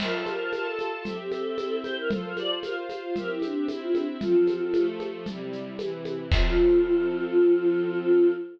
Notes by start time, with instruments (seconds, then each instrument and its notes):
0.00 string ensemble 1 F4 C5 A5, choir aahs A#4, crash, low conga, shaker
0.14 choir aahs A4
0.26 choir aahs A#4, high conga, shaker
0.53 string ensemble 1 F4 A4 A5, choir aahs A#4, high conga, shaker
0.67 choir aahs A4
0.79 high conga, shaker
1.04 string ensemble 1 C4 G4 E5, choir aahs A4, low conga, shaker
1.19 choir aahs G4
1.32 choir aahs A4, high conga, shaker
1.58 string ensemble 1 C4 E4 E5, high conga, shaker
1.84 choir aahs C5, high conga, shaker
1.97 choir aahs A#4
2.10 string ensemble 1 F4 A4 C5, choir aahs A4, low conga, shaker
2.24 choir aahs A#4
2.37 choir aahs D5, high conga, shaker
2.62 string ensemble 1 F4 C5 F5, choir aahs A#4, high conga, shaker
2.89 high conga, shaker
3.03 choir aahs F4
3.16 string ensemble 1 C4 G4 E5, choir aahs A#4, low conga, shaker
3.30 choir aahs E4
3.42 choir aahs D4, high conga, shaker
3.68 string ensemble 1 C4 E4 E5, choir aahs E4, high conga, shaker
3.81 choir aahs F4
3.95 choir aahs D4, high conga, shaker
4.20 string ensemble 1 F3 C4 A4, choir aahs F4, low conga, shaker
4.47 high conga, shaker
4.74 string ensemble 1 F3 A3 A4, high conga, shaker
5.00 high conga, shaker
5.26 string ensemble 1 C3 G3 E4, low conga, shaker
5.53 shaker
5.78 string ensemble 1 C3 E3 E4, high conga, shaker
6.05 high conga, shaker
6.31 string ensemble 1 F3 C4 A4, choir aahs F4, kick, crash